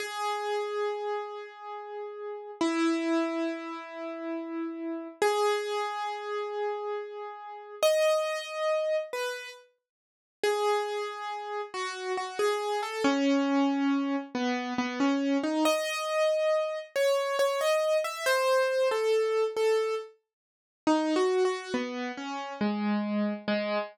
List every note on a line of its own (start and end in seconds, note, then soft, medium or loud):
0.00 2.51 G#4 medium
2.61 5.08 E4 medium
5.22 7.75 G#4 loud
7.83 8.96 D#5 loud
9.13 9.50 B4 medium
10.43 11.61 G#4 medium
11.74 12.12 F#4 medium
12.17 12.38 F#4 medium
12.39 12.81 G#4 medium
12.83 13.03 A4 medium
13.04 14.16 C#4 loud
14.35 14.74 B3 medium
14.78 14.99 B3 medium
15.00 15.37 C#4 medium
15.43 15.64 D#4 medium
15.65 16.78 D#5 loud
16.96 17.36 C#5 medium
17.39 17.60 C#5 medium
17.61 17.97 D#5 medium
18.04 18.25 E5 medium
18.26 18.88 C5 loud
18.91 19.44 A4 medium
19.57 19.95 A4 medium
20.87 21.14 D#4 medium
21.16 21.43 F#4 medium
21.45 21.72 F#4 medium
21.74 22.12 B3 medium
22.17 22.53 C#4 medium
22.61 23.33 G#3 medium
23.48 23.78 G#3 loud